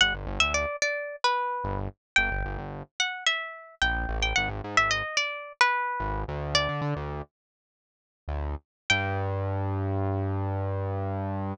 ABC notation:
X:1
M:4/4
L:1/16
Q:1/4=110
K:G
V:1 name="Acoustic Guitar (steel)"
f z2 e d2 d3 B5 z2 | g6 f2 e4 g3 g | _g z2 _f _e2 d3 B5 z2 | "^rit." d6 z10 |
g16 |]
V:2 name="Synth Bass 1" clef=bass
G,,, G,,, G,,, D,,9 G,,,4 | G,,, G,,, G,,, G,,,9 ^A,,,2 =A,,,2 | _A,,, A,,, _A,, A,,,9 A,,,2 D,,2- | "^rit." D,, D, D, D,,9 D,,4 |
G,,16 |]